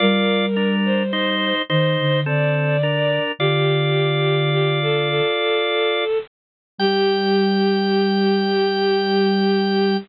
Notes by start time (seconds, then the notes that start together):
0.00 G3 F4 A#4 D5
0.56 D4 A#4
0.85 C5
1.13 D#4 C5
1.69 D#3 D#4 C5
1.99 D3
2.26 D3 C4 A4 D5
2.83 D4 A#4
3.39 D3 F4 G4 D5
4.52 G4
4.81 A4
5.09 A4
6.79 G3 G4 G5